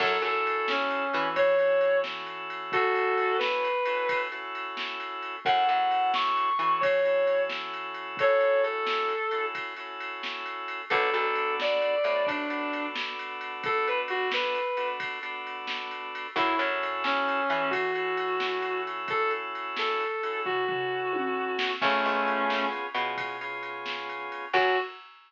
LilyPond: <<
  \new Staff \with { instrumentName = "Distortion Guitar" } { \time 12/8 \key fis \minor \tempo 4. = 88 a'8 a'4 cis'4. cis''4. r4. | <fis' a'>4. b'2 r2 r8 | fis''8 fis''4 cis'''4. cis''4. r4. | <a' cis''>4 a'2 r2. |
a'8 a'4 d''4. d'4. r4. | a'8 b'16 r16 fis'8 b'4. r2. | e'8 r4 cis'4. fis'2. | a'8 r4 a'4. fis'2. |
<a cis'>2 r1 | fis'4. r1 r8 | }
  \new Staff \with { instrumentName = "Drawbar Organ" } { \time 12/8 \key fis \minor <cis' e' fis' a'>2~ <cis' e' fis' a'>8 <cis' e' fis' a'>4 <cis' e' fis' a'>2~ <cis' e' fis' a'>8~ | <cis' e' fis' a'>2~ <cis' e' fis' a'>8 <cis' e' fis' a'>4 <cis' e' fis' a'>2~ <cis' e' fis' a'>8 | <cis' e' fis' a'>2~ <cis' e' fis' a'>8 <cis' e' fis' a'>4 <cis' e' fis' a'>2~ <cis' e' fis' a'>8~ | <cis' e' fis' a'>2~ <cis' e' fis' a'>8 <cis' e' fis' a'>4 <cis' e' fis' a'>2~ <cis' e' fis' a'>8 |
<b d' fis' a'>2~ <b d' fis' a'>8 <b d' fis' a'>4 <b d' fis' a'>2~ <b d' fis' a'>8~ | <b d' fis' a'>2~ <b d' fis' a'>8 <b d' fis' a'>4 <b d' fis' a'>2~ <b d' fis' a'>8 | <cis' e' fis' a'>2~ <cis' e' fis' a'>8 <cis' e' fis' a'>4 <cis' e' fis' a'>2~ <cis' e' fis' a'>8~ | <cis' e' fis' a'>2~ <cis' e' fis' a'>8 <cis' e' fis' a'>4 <cis' e' fis' a'>2~ <cis' e' fis' a'>8 |
<b cis' eis' gis'>2~ <b cis' eis' gis'>8 <b cis' eis' gis'>4 <b cis' eis' gis'>2~ <b cis' eis' gis'>8 | <cis' e' fis' a'>4. r1 r8 | }
  \new Staff \with { instrumentName = "Electric Bass (finger)" } { \clef bass \time 12/8 \key fis \minor fis,8 fis,2 e2.~ e8~ | e1. | fis,8 fis,2 e2.~ e8~ | e1. |
b,,8 b,,2 a,2.~ a,8~ | a,1. | fis,8 fis,2 e2.~ e8~ | e1. |
cis,8 cis,2 b,2.~ b,8 | fis,4. r1 r8 | }
  \new DrumStaff \with { instrumentName = "Drums" } \drummode { \time 12/8 <cymc bd>8 cymr8 cymr8 sn8 cymr8 cymr8 <bd cymr>8 cymr8 cymr8 sn8 cymr8 cymr8 | <bd cymr>8 cymr8 cymr8 sn8 cymr8 cymr8 <bd cymr>8 cymr8 cymr8 sn8 cymr8 cymr8 | <bd cymr>8 cymr8 cymr8 sn8 cymr8 cymr8 <bd cymr>8 cymr8 cymr8 sn8 cymr8 cymr8 | <bd cymr>8 cymr8 cymr8 sn8 cymr8 cymr8 <bd cymr>8 cymr8 cymr8 sn8 cymr8 cymr8 |
<bd cymr>8 cymr8 cymr8 sn8 cymr8 cymr8 <bd cymr>8 cymr8 cymr8 sn8 cymr8 cymr8 | <bd cymr>8 cymr8 cymr8 sn8 cymr8 cymr8 <bd cymr>8 cymr8 cymr8 sn8 cymr8 cymr8 | <bd cymr>8 cymr8 cymr8 sn8 cymr8 cymr8 <bd cymr>8 cymr8 cymr8 sn8 cymr8 cymr8 | <bd cymr>8 cymr8 cymr8 sn8 cymr8 cymr8 <bd tomfh>8 tomfh4 tommh4 sn8 |
<cymc bd>8 cymr8 cymr8 sn8 cymr8 cymr8 <bd cymr>8 cymr8 cymr8 sn8 cymr8 cymr8 | <cymc bd>4. r4. r4. r4. | }
>>